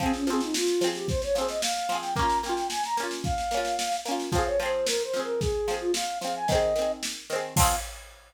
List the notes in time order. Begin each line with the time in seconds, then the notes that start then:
0.00 F3 C4, kick, snare
0.06 G#4
0.14 C#4, snare
0.27 F3 C4, snare
0.33 G#4
0.40 D#4, snare
0.54 F4, snare
0.67 snare
0.81 F3 C4, snare
0.87 G#4
0.95 G4, snare
1.08 C5, kick, snare
1.22 C#5, snare
1.34 F3 C4 C5, snare
1.41 G#4
1.49 D#5, snare
1.62 F5, snare
1.76 snare
1.89 F3 C4, snare
1.95 G#4
2.02 G5, snare
2.15 A#3 A#5, kick, snare
2.19 C#4 F4
2.30 snare
2.43 A#3 C#4 G5, snare
2.49 F4
2.55 G5, snare
2.70 G#5, snare
2.84 A#5, snare
2.97 A#3 C#4, snare
3.03 F4
3.11 snare
3.24 F5, kick, snare
3.38 snare
3.51 A#3 C#4, snare
3.57 F4
3.65 snare
3.79 snare
3.92 snare
4.05 A#3 C#4, snare
4.11 F4
4.19 snare
4.32 F3 C4 F5, kick, snare
4.38 G#4
4.46 C#5
4.60 F3 C4 C5, snare
4.66 G#4
4.86 A#4, snare
5.03 C5
5.13 F3 C4, snare
5.19 G#4 A#4
5.40 G#4, kick, snare
5.68 F3 C4, snare
5.74 G#4
5.79 F4
5.94 F5, snare
6.21 F3 C4 F5, snare
6.27 G#4
6.36 G#5
6.47 D#3 D#5, kick, snare
6.52 C4 G#4
6.76 D#3 C4, snare
6.82 G#4
7.03 snare
7.30 D#3 C4, snare
7.36 G#4
7.56 F3 C4 F5, kick, crash
7.63 G#4